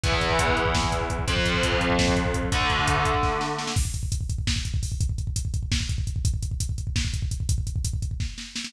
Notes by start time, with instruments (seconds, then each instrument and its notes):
0.03 overdriven guitar E2 E3 B3, kick, closed hi-hat
0.12 kick
0.21 kick, closed hi-hat
0.30 kick
0.39 kick, closed hi-hat
0.48 kick
0.57 kick, closed hi-hat
0.66 kick
0.74 kick, snare
0.83 kick
0.92 kick, closed hi-hat
1.01 kick
1.10 kick, closed hi-hat
1.19 kick
1.28 overdriven guitar F2 F3 C4, kick, closed hi-hat
1.37 kick
1.45 kick, closed hi-hat
1.54 kick
1.63 kick, closed hi-hat
1.72 kick
1.81 kick, closed hi-hat
1.90 kick
1.99 kick, snare
2.08 kick
2.16 kick, closed hi-hat
2.25 kick
2.34 kick, closed hi-hat
2.43 kick
2.52 overdriven guitar D3 A3 D4, kick, closed hi-hat
2.61 kick
2.70 kick, closed hi-hat
2.79 kick
2.88 kick, closed hi-hat
2.96 kick
3.05 kick, closed hi-hat
3.14 kick
3.23 kick, snare
3.41 snare
3.59 snare
3.67 snare
3.76 kick, crash
3.85 kick
3.94 kick, closed hi-hat
4.03 kick
4.12 kick, closed hi-hat
4.21 kick
4.29 kick, closed hi-hat
4.38 kick
4.47 kick, snare
4.56 kick
4.65 kick, closed hi-hat
4.74 kick
4.83 kick, open hi-hat
4.92 kick
5.01 kick, closed hi-hat
5.09 kick
5.18 kick, closed hi-hat
5.27 kick
5.36 kick, closed hi-hat
5.45 kick
5.54 kick, closed hi-hat
5.63 kick
5.72 kick, snare
5.80 kick
5.89 kick, closed hi-hat
5.98 kick
6.07 kick, closed hi-hat
6.16 kick
6.25 kick, closed hi-hat
6.34 kick
6.42 kick, closed hi-hat
6.51 kick
6.60 kick, closed hi-hat
6.69 kick
6.78 kick, closed hi-hat
6.87 kick
6.96 kick, snare
7.05 kick
7.14 kick, closed hi-hat
7.22 kick
7.31 kick, closed hi-hat
7.40 kick
7.49 kick, closed hi-hat
7.58 kick
7.67 kick, closed hi-hat
7.76 kick
7.85 kick, closed hi-hat
7.93 kick
8.02 kick, closed hi-hat
8.11 kick
8.20 kick, snare
8.38 snare
8.56 snare
8.64 snare